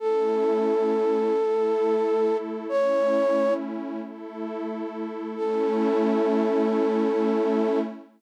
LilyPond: <<
  \new Staff \with { instrumentName = "Flute" } { \time 3/4 \key a \major \tempo 4 = 67 a'2. | cis''4 r2 | a'2. | }
  \new Staff \with { instrumentName = "Pad 2 (warm)" } { \time 3/4 \key a \major <a cis' e'>4. <a e' a'>4. | <a cis' e'>4. <a e' a'>4. | <a cis' e'>2. | }
>>